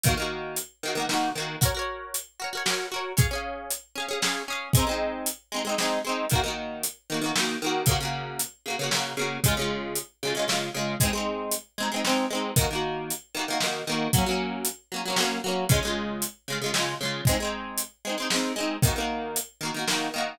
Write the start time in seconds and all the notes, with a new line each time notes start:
0.03 D#3 A#3, kick, closed hi-hat
0.09 F#4
0.17 D#3 A#3
0.22 F#4
0.56 closed hi-hat
0.83 D#3 A#3
0.88 F#4
0.95 D#3 A#3
1.00 F#4
1.09 D#3 A#3, snare
1.13 F#4
1.35 D#3 A#3
1.40 F#4
1.61 F#4 A#4, kick, closed hi-hat
1.66 C#5
1.75 F#4 A#4
1.79 C#5
2.14 closed hi-hat
2.40 F#4 A#4
2.44 C#5
2.53 F#4 A#4
2.57 C#5
2.66 F#4 A#4, snare
2.70 C#5
2.92 F#4 A#4
2.96 C#5
3.17 C#4 G#4, kick, closed hi-hat
3.21 F5
3.31 C#4 G#4
3.35 F5
3.71 closed hi-hat
3.96 C#4 G#4
4.00 F5
4.08 C#4 G#4
4.13 F5
4.22 C#4 G#4, snare
4.26 F5
4.48 C#4 G#4
4.52 F5
4.73 G#3 C4, kick, closed hi-hat
4.79 D#4
4.87 G#3 C4
4.91 D#4
5.26 closed hi-hat
5.52 G#3 C4
5.56 D#4
5.65 G#3 C4
5.69 D#4
5.78 G#3 C4, snare
5.82 D#4
6.05 G#3 C4
6.09 D#4
6.30 D#3 A#3, kick, closed hi-hat
6.35 F#4
6.44 D#3 A#3
6.48 F#4
6.83 closed hi-hat
7.10 D#3 A#3
7.14 F#4
7.22 D#3 A#3
7.26 F#4
7.36 D#3 A#3, snare
7.40 F#4
7.62 D#3 A#3
7.66 F#4
7.86 C#3 A#3, kick, closed hi-hat
7.91 F#4
8.00 C#3 A#3
8.05 F#4
8.39 closed hi-hat
8.66 C#3 A#3
8.70 F#4
8.79 C#3 A#3
8.83 F#4
8.91 C#3 A#3, snare
8.97 F#4
9.17 C#3 A#3
9.21 F#4
9.44 C#3 G#3, kick, closed hi-hat
9.48 F4
9.57 C#3 G#3
9.61 F4
9.96 closed hi-hat
10.23 C#3 G#3
10.27 F4
10.35 C#3 G#3
10.39 F4
10.48 C#3 G#3, snare
10.52 F4
10.74 C#3 G#3
10.79 F4
11.00 G#3 C4, kick, closed hi-hat
11.05 D#4
11.13 G#3 C4
11.17 D#4
11.52 closed hi-hat
11.78 G#3 C4
11.82 D#4
11.92 G#3 C4
11.96 D#4
12.05 G#3 C4, snare
12.09 D#4
12.30 G#3 C4
12.35 D#4
12.56 D#3 A#3, kick, closed hi-hat
12.61 F#4
12.71 D#3 A#3
12.75 F#4
13.10 closed hi-hat
13.35 D#3 A#3
13.39 F#4
13.48 D#3 A#3
13.52 F#4
13.60 D#3 A#3, snare
13.66 F#4
13.87 D#3 A#3
13.92 F#4
14.13 F#3 A#3, kick, closed hi-hat
14.18 C#4
14.26 F#3 A#3
14.31 C#4
14.65 closed hi-hat
14.92 F#3 A#3
14.96 C#4
15.06 F#3 A#3
15.10 C#4
15.16 F#3 A#3, snare
15.22 C#4
15.44 F#3 A#3
15.48 C#4
15.69 C#3 G#3, kick, closed hi-hat
15.74 F4
15.83 C#3 G#3
15.87 F4
16.22 closed hi-hat
16.48 C#3 G#3
16.52 F4
16.62 C#3 G#3
16.66 F4
16.74 C#3 G#3, snare
16.78 F4
17.01 C#3 G#3
17.05 F4
17.25 G#3, kick, closed hi-hat
17.29 C4 D#4
17.40 G#3 C4
17.45 D#4
17.78 closed hi-hat
18.05 G#3 C4
18.09 D#4
18.18 G#3 C4
18.22 D#4
18.30 G#3 C4, snare
18.36 D#4
18.56 G#3 C4
18.60 D#4
18.82 D#3 A#3, kick, closed hi-hat
18.87 F#4
18.96 D#3 A#3
19.00 F#4
19.36 closed hi-hat
19.61 D#3 A#3
19.65 F#4
19.74 D#3 A#3
19.79 F#4
19.88 D#3 A#3, snare
19.92 F#4
20.14 D#3 A#3
20.18 F#4